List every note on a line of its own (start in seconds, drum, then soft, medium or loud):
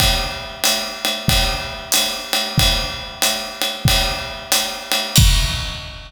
0.00 kick medium
0.00 ride loud
0.64 hi-hat pedal medium
0.64 ride loud
1.05 ride medium
1.28 kick medium
1.28 ride loud
1.92 hi-hat pedal loud
1.92 ride medium
2.33 ride medium
2.58 kick medium
2.58 ride loud
3.22 hi-hat pedal medium
3.22 ride medium
3.62 ride medium
3.85 kick medium
3.85 ride loud
4.52 hi-hat pedal medium
4.52 ride medium
4.92 ride medium
5.16 kick loud
5.16 crash loud